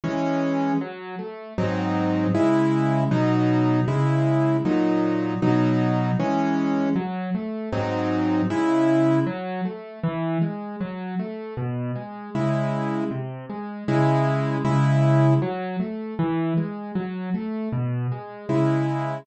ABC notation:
X:1
M:2/4
L:1/8
Q:1/4=78
K:C#m
V:1 name="Acoustic Grand Piano"
[E,G,C]2 | F, A, [G,,F,^B,D]2 | [C,G,E]2 [B,,F,D]2 | [C,G,E]2 [^A,,F,D]2 |
[B,,F,D]2 [E,G,C]2 | F, A, [G,,F,^B,D]2 | [C,G,E]2 F, A, | E, G, F, A, |
B,, G, [C,G,E]2 | ^B,, G, [C,G,E]2 | [C,G,E]2 F, A, | E, G, F, A, |
B,, G, [C,G,E]2 |]